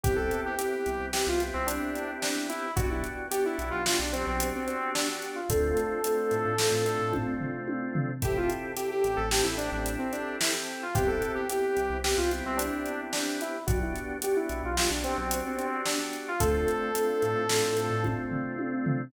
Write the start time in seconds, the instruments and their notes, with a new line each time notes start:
0.03 synth bass 1 C2, drawbar organ B3 C4 E4 G4, lead 2 (sawtooth) G4, kick, closed hi-hat
0.16 lead 2 (sawtooth) A4
0.31 closed hi-hat
0.46 lead 2 (sawtooth) G4
0.58 drawbar organ B3 C4 E4 G4, lead 2 (sawtooth) G4, closed hi-hat
0.86 synth bass 1 C2, closed hi-hat
1.00 synth bass 1 C2
1.13 drawbar organ B3 C4 E4 G4, lead 2 (sawtooth) G4, snare
1.27 synth bass 1 C2, lead 2 (sawtooth) F4
1.40 drawbar organ B3 C4 E4 G4, closed hi-hat
1.54 synth bass 1 C2, lead 2 (sawtooth) C4
1.66 lead 2 (sawtooth) D4, closed hi-hat
1.95 closed hi-hat
2.22 lead 2 (sawtooth) D4, snare
2.49 lead 2 (sawtooth) E4, closed hi-hat
2.76 synth bass 1 B1, drawbar organ B3 D4 F#4 G4, lead 2 (sawtooth) F#4, kick, closed hi-hat
2.91 lead 2 (sawtooth) E4
3.04 closed hi-hat
3.31 drawbar organ B3 D4 F#4 G4, lead 2 (sawtooth) G4, closed hi-hat
3.45 lead 2 (sawtooth) E4
3.58 synth bass 1 B1, closed hi-hat
3.71 synth bass 1 B1, lead 2 (sawtooth) F4
3.86 drawbar organ B3 D4 F#4 G4, lead 2 (sawtooth) F4, snare
3.99 synth bass 1 B1, lead 2 (sawtooth) D4
4.13 drawbar organ B3 D4 F#4 G4, lead 2 (sawtooth) C4, closed hi-hat
4.27 synth bass 1 B1, lead 2 (sawtooth) C4
4.40 closed hi-hat
4.55 lead 2 (sawtooth) C4
4.66 lead 2 (sawtooth) C4, closed hi-hat
4.95 lead 2 (sawtooth) D4, snare
5.22 closed hi-hat
5.35 lead 2 (sawtooth) F4
5.49 synth bass 1 D2, drawbar organ A3 C4 D4 F4, lead 2 (sawtooth) A4, kick, closed hi-hat
5.77 closed hi-hat
6.04 drawbar organ A3 C4 D4 F4, closed hi-hat
6.31 synth bass 1 A2, closed hi-hat
6.45 synth bass 1 A2
6.58 drawbar organ A3 C4 D4 F4, snare
6.72 synth bass 1 A2
6.85 drawbar organ A3 C4 D4 F4, closed hi-hat
6.99 synth bass 1 A2
7.13 kick, high tom
7.40 floor tom
7.68 high tom
7.95 floor tom
8.22 synth bass 1 A1, drawbar organ C4 E4 G4 A4, lead 2 (sawtooth) G4, kick, closed hi-hat
8.37 lead 2 (sawtooth) F4
8.50 closed hi-hat
8.76 drawbar organ C4 E4 G4 A4, lead 2 (sawtooth) G4, closed hi-hat
8.91 lead 2 (sawtooth) G4
9.04 synth bass 1 A1, closed hi-hat
9.16 synth bass 1 A1, lead 2 (sawtooth) A4
9.31 drawbar organ C4 E4 G4 A4, lead 2 (sawtooth) G4, snare
9.43 synth bass 1 A1, lead 2 (sawtooth) E4
9.57 drawbar organ C4 E4 G4 A4, lead 2 (sawtooth) D4, closed hi-hat
9.72 synth bass 1 A1, lead 2 (sawtooth) D4
9.86 closed hi-hat
9.99 lead 2 (sawtooth) C4
10.12 lead 2 (sawtooth) D4, closed hi-hat
10.41 lead 2 (sawtooth) E4, snare
10.83 lead 2 (sawtooth) F4
10.95 synth bass 1 C2, drawbar organ B3 C4 E4 G4, lead 2 (sawtooth) G4, kick, closed hi-hat
11.07 lead 2 (sawtooth) A4
11.22 closed hi-hat
11.35 lead 2 (sawtooth) G4
11.49 drawbar organ B3 C4 E4 G4, lead 2 (sawtooth) G4, closed hi-hat
11.77 synth bass 1 C2, closed hi-hat
11.90 synth bass 1 C2
12.04 drawbar organ B3 C4 E4 G4, lead 2 (sawtooth) G4, snare
12.17 synth bass 1 C2, lead 2 (sawtooth) F4
12.31 drawbar organ B3 C4 E4 G4, closed hi-hat
12.45 synth bass 1 C2, lead 2 (sawtooth) C4
12.57 lead 2 (sawtooth) D4, closed hi-hat
12.86 closed hi-hat
13.13 lead 2 (sawtooth) D4, snare
13.41 lead 2 (sawtooth) E4, closed hi-hat
13.66 synth bass 1 B1, drawbar organ B3 D4 F#4 G4, lead 2 (sawtooth) F#4, kick, closed hi-hat
13.83 lead 2 (sawtooth) E4
13.96 closed hi-hat
14.22 drawbar organ B3 D4 F#4 G4, lead 2 (sawtooth) G4, closed hi-hat
14.36 lead 2 (sawtooth) E4
14.49 synth bass 1 B1, closed hi-hat
14.63 synth bass 1 B1, lead 2 (sawtooth) F4
14.76 drawbar organ B3 D4 F#4 G4, lead 2 (sawtooth) F4, snare
14.90 synth bass 1 B1, lead 2 (sawtooth) D4
15.04 drawbar organ B3 D4 F#4 G4, lead 2 (sawtooth) C4, closed hi-hat
15.18 synth bass 1 B1, lead 2 (sawtooth) C4
15.31 closed hi-hat
15.46 lead 2 (sawtooth) C4
15.58 lead 2 (sawtooth) C4, closed hi-hat
15.85 lead 2 (sawtooth) D4, snare
16.13 closed hi-hat
16.28 lead 2 (sawtooth) F4
16.40 synth bass 1 D2, drawbar organ A3 C4 D4 F4, lead 2 (sawtooth) A4, kick, closed hi-hat
16.68 closed hi-hat
16.94 drawbar organ A3 C4 D4 F4, closed hi-hat
17.22 synth bass 1 A2, closed hi-hat
17.36 synth bass 1 A2
17.49 drawbar organ A3 C4 D4 F4, snare
17.63 synth bass 1 A2
17.77 drawbar organ A3 C4 D4 F4, closed hi-hat
17.90 synth bass 1 A2
18.04 kick, high tom
18.31 floor tom
18.59 high tom
18.86 floor tom